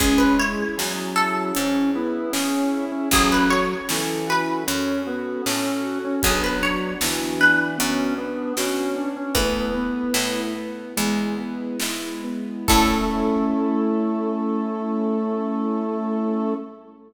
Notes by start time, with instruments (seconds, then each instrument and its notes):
0.00 harpsichord C#2 G#4, drawbar organ G#3, string ensemble 1 C#4 E4 G#4, acoustic grand piano C#4, kick, closed hi-hat
0.18 harpsichord B4
0.39 acoustic grand piano E4, harpsichord C#5
0.77 harpsichord E2, drawbar organ F#3, acoustic grand piano G#4, snare
1.16 acoustic grand piano E4, harpsichord A4
1.55 harpsichord G#2, acoustic grand piano C#4, drawbar organ C#4, closed hi-hat
1.95 drawbar organ B3, acoustic grand piano E4
2.33 harpsichord C#3, drawbar organ C#4, acoustic grand piano G#4, snare
2.72 acoustic grand piano E4
2.92 drawbar organ C#4
3.11 harpsichord A1 G#4, drawbar organ F#3, acoustic grand piano C#4, string ensemble 1 C#4 F#4 A4, kick, closed hi-hat
3.32 harpsichord B4
3.50 acoustic grand piano F#4, harpsichord C#5
3.89 harpsichord C#2, drawbar organ E3, acoustic grand piano A4, snare
4.27 acoustic grand piano F#4, harpsichord B4
4.67 harpsichord F#2, drawbar organ C#4, acoustic grand piano C#4, closed hi-hat
5.06 drawbar organ B3, acoustic grand piano F#4
5.46 harpsichord A2, drawbar organ C#4, acoustic grand piano A4, snare
5.84 acoustic grand piano F#4
6.04 drawbar organ C#4
6.22 harpsichord B1 G#4, drawbar organ F#3, acoustic grand piano B3, string ensemble 1 B3 D4 F#4, kick, closed hi-hat
6.44 harpsichord B4
6.63 acoustic grand piano D4, harpsichord C#5
7.01 harpsichord D2, drawbar organ E3, acoustic grand piano F#4, snare
7.40 acoustic grand piano D4, harpsichord B4
7.78 harpsichord F#2, acoustic grand piano B3, drawbar organ C#4, closed hi-hat
8.18 drawbar organ B3, acoustic grand piano D4
8.57 harpsichord B2, drawbar organ C#4, acoustic grand piano F#4, snare
8.96 acoustic grand piano D4
9.16 drawbar organ C#4
9.35 harpsichord E2 B4, acoustic grand piano A3, string ensemble 1 A3 B3 E4, drawbar organ B3, kick, closed hi-hat
9.75 acoustic grand piano B3
10.14 harpsichord A2, acoustic grand piano E4, snare
10.56 acoustic grand piano B3
10.96 harpsichord E2, string ensemble 1 G#3 B3 E4, acoustic grand piano G#3, closed hi-hat
11.38 acoustic grand piano B3
11.80 harpsichord G#2, acoustic grand piano E4, snare
12.24 acoustic grand piano B3
12.68 harpsichord A2 A4, drawbar organ A3, acoustic grand piano C#4 E4 A4, string ensemble 1 C#4 E4 A4, kick, crash